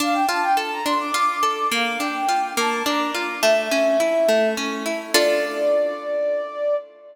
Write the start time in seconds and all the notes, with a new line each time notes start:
0.00 D4 F5
0.13 G5
0.28 F4 A5
0.42 G5
0.57 A4 A5
0.71 A#5
0.85 D4 C6
1.00 D6
1.14 F4 D6
1.43 A4
1.72 A#3 F5
1.99 D4 G5
2.29 F4
2.57 A#3 A5
2.86 D4 A#5
3.15 F4
3.42 A3 E5
3.71 C#4
4.00 E4
4.28 A3
4.57 C#4
4.86 E4
5.14 D4 F4 A4 D5